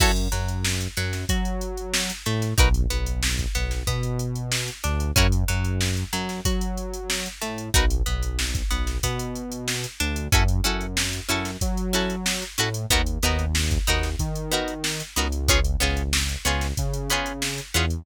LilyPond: <<
  \new Staff \with { instrumentName = "Pizzicato Strings" } { \time 4/4 \key fis \dorian \tempo 4 = 93 <e' fis' a' cis''>8 fis4 fis8 fis'4. a8 | <dis' fis' ais' b'>8 b4 b8 b4. d'8 | <cis' e' fis' ais'>8 fis4 fis8 fis'4. a8 | <dis' fis' ais' b'>8 b4 b8 b4. d'8 |
<cis' e' fis' a'>8 <cis' e' fis' a'>4 <cis' e' fis' a'>4 <cis' e' fis' a'>4 <cis' e' fis' a'>8 | <b dis' fis' ais'>8 <b dis' fis' ais'>4 <b dis' fis' ais'>4 <b dis' fis' ais'>4 <b dis' fis' ais'>8 | <b cis' eis' gis'>8 <b cis' eis' gis'>4 <b cis' eis' gis'>4 <b cis' eis' gis'>4 <b cis' eis' gis'>8 | }
  \new Staff \with { instrumentName = "Synth Bass 1" } { \clef bass \time 4/4 \key fis \dorian fis,8 fis,4 fis,8 fis4. a,8 | b,,8 b,,4 b,,8 b,4. d,8 | fis,8 fis,4 fis,8 fis4. a,8 | b,,8 b,,4 b,,8 b,4. d,8 |
fis,8 fis,4 fis,8 fis4. a,8 | dis,8 dis,4 dis,8 dis4. cis,8~ | cis,8 cis,4 cis,8 cis4. e,8 | }
  \new DrumStaff \with { instrumentName = "Drums" } \drummode { \time 4/4 <cymc bd>16 hh16 hh16 hh16 sn16 hh16 <hh sn>16 <hh sn>16 <hh bd>16 hh16 hh16 hh16 sn16 hh16 hh16 <hh sn>16 | <hh bd>16 hh16 hh16 hh16 sn16 <hh bd>16 hh16 <hh sn>16 <hh bd>16 hh16 hh16 hh16 sn16 hh16 hh16 hh16 | <hh bd>16 hh16 hh16 hh16 sn16 hh16 hh16 <hh sn>16 <hh bd>16 hh16 hh16 hh16 sn16 hh16 hh16 hh16 | <hh bd>16 hh16 hh16 hh16 sn16 <hh bd sn>16 hh16 <hh sn>16 <hh bd>16 hh16 hh16 hh16 sn16 hh16 hh16 hh16 |
<hh bd>16 hh16 hh16 hh16 sn16 hh16 hh16 <hh sn>16 <hh bd>16 hh16 <hh sn>16 hh16 sn16 <hh sn>16 hh16 hh16 | <hh bd>16 hh16 <hh sn>16 hh16 sn16 <hh bd>16 <hh sn>16 <hh sn>16 <hh bd>16 hh16 hh16 hh16 sn16 hh16 hh16 hh16 | <hh bd>16 hh16 <hh sn>16 hh16 sn16 hh16 hh16 <hh sn>16 <hh bd>16 hh16 hh16 hh16 sn16 hh16 hh16 hh16 | }
>>